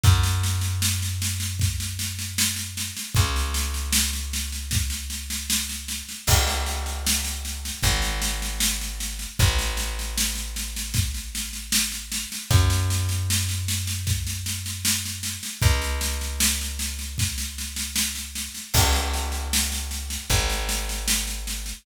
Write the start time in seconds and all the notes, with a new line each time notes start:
0.04 F#2, kick, snare
0.23 snare
0.44 snare
0.61 snare
0.82 snare
1.02 snare
1.22 snare
1.40 snare
1.60 kick, snare
1.80 snare
1.99 snare
2.19 snare
2.38 snare
2.56 snare
2.77 snare
2.97 snare
3.15 C#2, kick, snare
3.36 snare
3.54 snare
3.74 snare
3.93 snare
4.13 snare
4.33 snare
4.52 snare
4.71 kick, snare
4.90 snare
5.10 snare
5.30 snare
5.50 snare
5.69 snare
5.88 snare
6.09 snare
6.27 C#2, kick, snare, crash
6.47 snare
6.66 snare
6.86 snare
7.07 snare
7.25 snare
7.45 snare
7.65 snare
7.83 G#1, kick, snare
8.02 snare
8.22 snare
8.42 snare
8.60 snare
8.81 snare
9.00 snare
9.19 snare
9.39 A1, kick, snare
9.59 snare
9.77 snare
9.99 snare
10.18 snare
10.35 snare
10.56 snare
10.76 snare
10.94 kick, snare
11.14 snare
11.35 snare
11.53 snare
11.72 snare
11.92 snare
12.12 snare
12.32 snare
12.51 F#2, kick, snare
12.70 snare
12.90 snare
13.09 snare
13.30 snare
13.49 snare
13.68 snare
13.87 snare
14.07 kick, snare
14.27 snare
14.46 snare
14.66 snare
14.85 snare
15.06 snare
15.23 snare
15.43 snare
15.62 C#2, kick, snare
15.82 snare
16.01 snare
16.21 snare
16.40 snare
16.61 snare
16.79 snare
16.99 snare
17.18 kick, snare
17.38 snare
17.58 snare
17.76 snare
17.96 snare
18.15 snare
18.35 snare
18.55 snare
18.74 C#2, kick, snare, crash
18.93 snare
19.14 snare
19.32 snare
19.53 snare
19.72 snare
19.91 snare
20.10 snare
20.30 G#1, kick, snare
20.50 snare
20.69 snare
20.89 snare
21.08 snare
21.27 snare
21.47 snare
21.66 snare